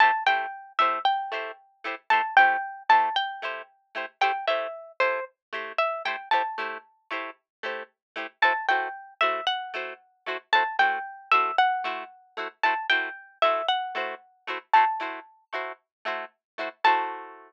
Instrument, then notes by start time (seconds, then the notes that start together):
acoustic guitar (steel)
0.00 A3 E4 G4 C5 A5
0.26 A3 E4 G4 C5 G5
0.79 A3 E4 G4 C5 E5
1.05 G5
1.32 A3 E4 G4 C5
1.84 A3 E4 G4 C5
2.10 A3 E4 G4 C5 A5
2.37 A3 E4 G4 C5 G5
2.89 A3 E4 G4 C5 A5
3.16 G5
3.42 A3 E4 G4 C5
3.95 A3 E4 G4 C5
4.21 A3 E4 G4 C5 G5
4.47 A3 E4 G4 C5 E5
5.00 A3 E4 G4 C5
5.53 A3 E4 G4 C5
5.78 E5
6.05 A3 E4 G4 C5 G5
6.31 A3 E4 G4 C5 A5
6.58 A3 E4 G4 C5
7.11 A3 E4 G4 C5
7.63 A3 E4 G4 C5
8.16 A3 E4 G4 C5
8.42 A3 E4 F#4 C5 A5
8.69 A3 E4 F#4 C5 G5
9.21 A3 E4 F#4 C5 E5
9.47 F#5
9.74 A3 E4 F#4 C5
10.26 A3 E4 F#4 C5
10.53 A3 E4 F#4 C5 A5
10.79 A3 E4 F#4 C5 G5
11.31 A3 E4 F#4 C5 E5
11.58 F#5
11.84 A3 E4 F#4 C5
12.37 A3 E4 F#4 C5
12.63 A3 E4 F#4 C5 A5
12.89 A3 E4 F#4 C5 G5
13.42 A3 E4 F#4 C5 E5
13.68 F#5
13.95 A3 E4 F#4 C5
14.47 A3 E4 F#4 C5
14.73 A3 E4 F#4 C5 A5
15.00 A3 E4 F#4 C5
15.53 A3 E4 F#4 C5
16.05 A3 E4 F#4 C5
16.58 A3 E4 F#4 C5
16.84 A3 E4 F#4 C5 A5